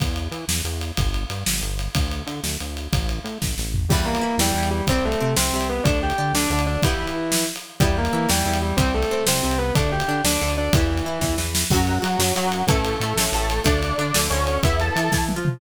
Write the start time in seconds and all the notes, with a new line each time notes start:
0.00 E2, kick, ride
0.16 ride
0.31 E3, ride
0.48 E2, snare
0.64 E2, ride
0.81 ride
0.97 G1, kick, ride
1.14 ride
1.30 G2, ride
1.46 G1, snare
1.61 G1, ride
1.79 ride
1.95 D2, kick, ride
2.11 ride
2.27 D3, ride
2.43 D2, snare
2.60 D2, ride
2.77 ride
2.92 A1, kick, ride
3.09 ride
3.24 A2, ride
3.42 A1, kick, snare
3.58 A1, snare
3.74 floor tom
3.89 E2 E3 G3 G4, kick, crash
3.93 B3
4.05 A#3 A#4
4.15 ride
4.21 E3 E4
4.38 E2 E3 G3 G4, snare
4.54 E2 E3
4.63 ride
4.70 G3 G4
4.87 C2 G3 C4 C5, kick, ride
5.05 A3 A4
5.12 ride
5.20 C3 C4
5.36 C2 C3 C4 C5, snare
5.53 C2 C3
5.61 ride
5.69 B3 B4
5.84 D2 A3 D4 D5, kick, ride
6.03 G4 G5
6.10 ride
6.18 D3 D4
6.33 D2 D3 D4 D5, snare
6.50 D2 D3
6.59 ride
6.66 D4 D5
6.82 E3 G3 B3 E4, kick, ride
7.07 ride
7.32 snare
7.56 ride
7.80 E2 G3 B3 E4 G4, kick, ride
7.98 A#3 A#4
8.05 ride
8.13 E3 E4
8.29 E2 E3 G3 G4, snare
8.45 E2 E3
8.54 ride
8.62 G3 G4
8.77 C2 G3 C4 C5, kick, ride
8.94 A3 A4
9.03 ride
9.11 C3 C4
9.26 C2 C3 C4 C5, snare
9.43 C2 C3
9.51 ride
9.58 B3 B4
9.75 D2 A3 D4 D5, kick, ride
9.92 G4 G5
10.00 ride
10.08 D3 D4
10.24 D2 D3 D4 D5, snare
10.41 D2 D3
10.48 ride
10.57 D4 D5
10.73 E2 E3 G3 B3 E4, kick, ride
10.97 ride
11.05 E3 E4
11.21 E2 E3, kick, snare
11.37 E2 E3, snare
11.55 snare
11.70 F#2 F#3 C#4 F#4, kick, crash
11.87 ride
12.02 F#3 F#4, ride
12.19 F#2 F#3, snare
12.35 F#2 F#3 F#4, ride
12.52 ride
12.67 A1 E3 A3 C#4 A4, kick, ride
12.85 ride
13.00 A2 A3, ride
13.16 A1 A2, snare
13.32 A1 A2 A3 A4, ride
13.50 ride
13.64 D2 A3 D4 D5, kick, ride
13.83 ride
13.98 D3 D4, ride
14.14 D2 D3, snare
14.30 D2 D3 C#4 C#5, ride
14.47 ride
14.63 E2 B3 E4 E5, kick, ride
14.80 A4 A5, ride
14.96 E3 E4, ride
15.12 E3 E4, kick, snare
15.29 high tom
15.36 F3 F4
15.45 mid tom